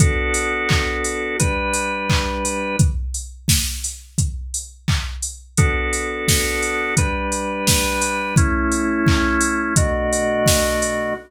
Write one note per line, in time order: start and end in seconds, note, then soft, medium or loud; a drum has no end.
0.00 1.37 B3 medium
0.00 1.37 D4 medium
0.00 1.37 F#4 medium
0.00 1.37 A4 medium
0.00 kick loud
0.00 closed hi-hat loud
0.34 open hi-hat medium
0.69 kick medium
0.69 clap loud
1.04 open hi-hat medium
1.39 2.76 G3 medium
1.39 2.76 D4 loud
1.39 2.76 B4 medium
1.39 kick medium
1.39 closed hi-hat loud
1.74 open hi-hat medium
2.10 kick medium
2.10 clap loud
2.45 open hi-hat medium
2.79 kick loud
2.79 closed hi-hat loud
3.14 open hi-hat medium
3.48 kick medium
3.48 snare loud
3.84 open hi-hat medium
4.18 kick medium
4.18 closed hi-hat loud
4.54 open hi-hat medium
4.88 kick medium
4.88 clap loud
5.22 open hi-hat medium
5.57 6.95 B3 medium
5.57 6.95 D4 medium
5.57 6.95 F#4 medium
5.57 6.95 A4 medium
5.57 kick loud
5.57 closed hi-hat loud
5.93 open hi-hat medium
6.28 kick medium
6.28 snare loud
6.62 open hi-hat medium
6.97 8.35 G3 medium
6.97 8.35 D4 loud
6.97 8.35 B4 medium
6.97 kick medium
6.97 closed hi-hat loud
7.32 open hi-hat medium
7.67 kick medium
7.67 snare loud
8.01 open hi-hat medium
8.36 9.74 A3 medium
8.36 9.74 C#4 medium
8.36 9.74 E4 loud
8.36 kick loud
8.36 closed hi-hat loud
8.72 open hi-hat medium
9.07 kick loud
9.07 clap loud
9.41 open hi-hat medium
9.76 11.14 B2 medium
9.76 11.14 A3 medium
9.76 11.14 D4 medium
9.76 11.14 F#4 medium
9.76 kick loud
9.76 closed hi-hat loud
10.13 open hi-hat medium
10.46 kick medium
10.46 snare loud
10.82 open hi-hat medium